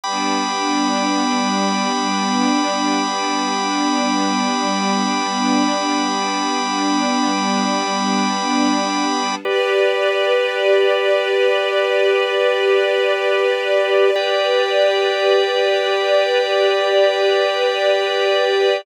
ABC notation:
X:1
M:4/4
L:1/8
Q:1/4=51
K:Gmix
V:1 name="String Ensemble 1"
[G,B,D]8- | [G,B,D]8 | [GBd]8- | [GBd]8 |]
V:2 name="Drawbar Organ"
[gbd']8- | [gbd']8 | [GBd]8 | [Gdg]8 |]